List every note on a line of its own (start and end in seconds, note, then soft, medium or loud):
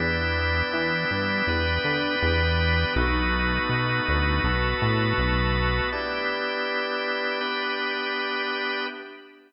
0.00 0.63 E2 medium
0.00 1.47 B3 medium
0.00 1.47 D4 medium
0.00 1.47 E4 medium
0.00 1.47 G4 medium
0.00 2.93 G4 medium
0.00 2.93 B4 loud
0.00 2.93 D5 medium
0.00 2.93 E5 loud
0.73 1.05 E3 medium
1.11 1.42 G2 medium
1.47 1.79 E2 medium
1.47 2.95 B3 medium
1.47 2.95 D4 medium
1.47 2.95 G4 loud
1.47 2.95 B4 loud
1.84 2.16 D3 medium
2.22 2.85 E2 medium
2.96 3.59 B1 loud
2.96 4.43 A3 medium
2.96 4.43 B3 loud
2.96 4.43 D#4 loud
2.96 4.43 F#4 medium
2.96 5.90 F#4 loud
2.96 5.90 A4 loud
2.96 5.90 B4 loud
2.96 5.90 D#5 medium
3.69 4.01 B2 medium
4.08 4.40 D2 medium
4.44 4.75 B1 medium
4.44 5.91 A3 loud
4.44 5.91 B3 medium
4.44 5.91 F#4 medium
4.44 5.91 A4 medium
4.82 5.13 A2 medium
5.18 5.81 B1 medium
5.92 7.40 B3 medium
5.92 7.40 D4 medium
5.92 7.40 E4 medium
5.92 8.86 G4 loud
5.92 7.40 G4 medium
5.92 8.86 B4 medium
5.92 8.86 D5 medium
5.92 8.86 E5 medium
7.41 8.87 B3 medium
7.41 8.87 D4 medium
7.41 8.87 G4 medium
7.41 8.87 B4 medium